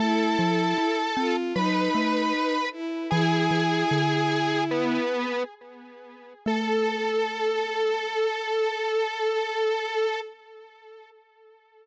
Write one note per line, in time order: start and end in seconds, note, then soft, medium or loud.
0.00 0.37 A3 loud
0.00 0.97 E4 loud
0.00 1.35 A4 medium
0.00 1.35 A5 loud
0.39 0.74 F3 medium
0.78 1.15 E4 medium
1.17 1.53 C4 medium
1.17 1.53 F4 loud
1.56 1.89 F#3 medium
1.56 2.57 D#4 loud
1.56 2.69 B4 medium
1.56 2.69 B5 medium
1.95 2.32 A3 medium
2.72 3.07 E4 medium
3.11 3.49 E3 loud
3.11 5.00 E4 loud
3.11 4.63 G#4 loud
3.11 4.63 G#5 loud
3.51 3.84 E3 medium
3.91 4.98 D3 medium
4.71 5.43 B3 medium
4.71 5.43 B4 medium
6.45 10.19 A3 loud
6.45 10.18 A4 loud
6.45 10.20 A4 loud